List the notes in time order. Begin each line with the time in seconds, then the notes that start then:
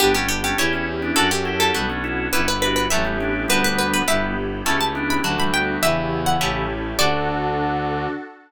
0.00 G1 B3 D4 G4
0.15 A3 C#4 G4
0.29 G4
0.44 A3 C#4 G4
0.58 E2 C#4 E4 G4 C#5
0.73 C#4 E4
1.02 B3 D4
1.16 F#2 C#4 D4 F#4 A4
1.31 G4
1.45 E4 G4
1.60 A4
1.74 B1 G3 B3 D4 F#4
1.90 A3 C#4
2.04 C#4 E4
2.33 G1 B3 C#4 E4 G4 B4
2.48 B4
2.62 D4 F#4 B4
2.76 B4
2.90 A1 F#3 A3 C#4 E4 G4 E5
3.05 G3 B3
3.20 B3 D4
3.48 D2 G3 B3 D4 F#4 B4
3.64 B4
3.79 B4
3.94 B4
4.08 G1 G3 B3 E4 G4 E5
4.66 C#2 A3 C#4 E4 G4 A5
4.81 A5
4.95 B3 D4
5.10 B5
5.23 D2 D3 F#3 A3 D4 F#4
5.38 E3 G3 B5
5.54 G3 B3 G5
5.83 E2 C#3 E3 B3 E4 G4 E5
6.26 F#5
6.40 A1 A3 C#4 E4 G4
6.98 D2 D3 D4 F#4 A4 D5